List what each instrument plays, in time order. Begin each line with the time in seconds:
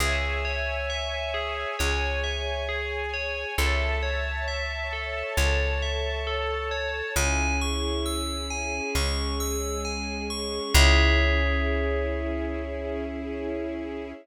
0.00 electric bass (finger) C#2, tubular bells G#4, string ensemble 1 C#5 E5 G#5
0.45 tubular bells C#5
0.90 tubular bells E5
1.34 tubular bells G#4
1.78 electric bass (finger) C#2, string ensemble 1 G#4 C#5 G#5, tubular bells C#5
2.24 tubular bells E5
2.69 tubular bells G#4
3.14 tubular bells C#5
3.58 electric bass (finger) C#2, tubular bells A4, string ensemble 1 C#5 E5 A5
4.03 tubular bells C#5
4.48 tubular bells E5
4.93 tubular bells A4
5.37 electric bass (finger) C#2, string ensemble 1 A4 C#5 A5, tubular bells C#5
5.82 tubular bells E5
6.27 tubular bells A4
6.71 tubular bells C#5
7.16 electric bass (finger) C#2, string ensemble 1 C#4 E4 G#4, tubular bells G#5
7.61 tubular bells C#6
8.06 tubular bells E6
8.50 tubular bells G#5
8.95 electric bass (finger) C#2, string ensemble 1 G#3 C#4 G#4, tubular bells C#6
9.40 tubular bells E6
9.85 tubular bells G#5
10.30 tubular bells C#6
10.73 electric bass (finger) C#2, string ensemble 1 C#4 E4 G#4, tubular bells G#4 C#5 E5